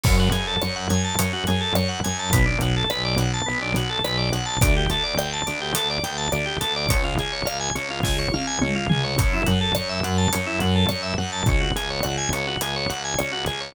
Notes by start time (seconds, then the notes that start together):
0.04 F#2 C#4, kick, crash
0.19 F#4
0.31 F#2 G#4, closed hi-hat
0.47 A4
0.62 F#2 C#5, cross-stick
0.76 F#5
0.89 F#2 G#5, closed hi-hat
1.04 A5
1.19 F#2 C#4, closed hi-hat
1.33 F#4
1.47 F#2 G#4, closed hi-hat
1.61 A4
1.75 F#2 C#5, cross-stick
1.89 F#5
2.04 F#2 G#5, closed hi-hat
2.19 A5
2.33 B1 B3, kick, closed hi-hat
2.46 D4
2.60 B1 F#4, closed hi-hat
2.77 A4
2.90 B1 B4, cross-stick
3.05 D5
3.17 B1 F#5, closed hi-hat
3.34 A5
3.46 B1 B3
3.62 D4
3.74 B1 F#4, closed hi-hat
3.90 A4
4.04 B1 B4, cross-stick
4.18 D5
4.33 B1 F#5, closed hi-hat
4.46 A5
4.61 D2 D4, kick, closed hi-hat
4.77 G4
4.90 D2 A4, closed hi-hat
5.03 D5
5.17 D2 G5, cross-stick
5.33 A5
5.46 D2 D4, closed hi-hat
5.61 G4
5.74 D2 A4, closed hi-hat
5.90 D5
6.04 D2 G5, closed hi-hat
6.18 A5
6.32 D2 D4, cross-stick
6.46 G4
6.61 D2 A4, closed hi-hat
6.76 D5
6.89 C#2 C#4, kick, closed hi-hat
7.04 F4
7.18 C#2 G#4, closed hi-hat
7.33 C#5
7.45 C#2 F5, cross-stick
7.60 G#5
7.75 C#2 C#4, closed hi-hat
7.91 F4
8.03 C#2 G#4, kick, snare
8.19 C#5
8.32 C#2 F5, high tom
8.47 G#5
8.61 C#2 C#4, mid tom
8.76 F4
8.89 C#2 G#4, floor tom
9.04 C#5
9.18 F#2 C#4, kick, closed hi-hat
9.34 E4
9.46 F#2 F#4, closed hi-hat
9.61 A4
9.75 F#2 C#5, cross-stick
9.89 E5
10.03 F#2 F#5, closed hi-hat
10.18 A5
10.33 F#2 C#4, closed hi-hat
10.47 E4
10.60 F#2 F#4, closed hi-hat
10.75 A4
10.89 F#2 C#5, cross-stick
11.03 E5
11.18 F#2 F#5
11.33 A5
11.46 C#2 C#4, kick, closed hi-hat
11.60 F#4
11.76 C#2 G#4, closed hi-hat
11.90 C#5
12.03 C#2 F#5, cross-stick
12.18 G#5
12.32 C#2 C#4, closed hi-hat
12.47 F#4
12.61 C#2 G#4, closed hi-hat
12.76 C#5
12.89 C#2 F#5, closed hi-hat
13.05 G#5
13.18 C#2 C#4, cross-stick
13.32 F#4
13.46 C#2 G#4, closed hi-hat
13.61 C#5